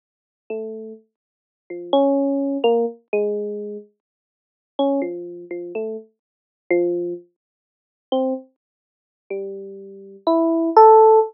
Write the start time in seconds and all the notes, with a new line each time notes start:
0.50 A3
1.70 F3
1.93 C#4
2.64 A#3
3.13 G#3
4.79 C#4
5.02 F3
5.51 F3
5.75 A3
6.70 F3
8.12 C4
9.30 G3
10.27 E4
10.76 A4